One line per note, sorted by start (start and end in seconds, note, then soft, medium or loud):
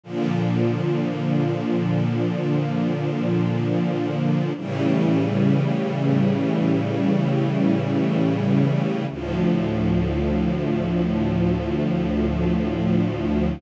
0.04 4.52 A#2 medium
0.04 4.52 D3 medium
0.04 4.52 F3 medium
4.57 9.05 A2 medium
4.57 9.05 C#3 medium
4.57 9.05 E3 medium
4.57 9.05 G3 medium
9.10 13.58 D2 medium
9.10 13.58 A2 medium
9.10 13.58 F3 medium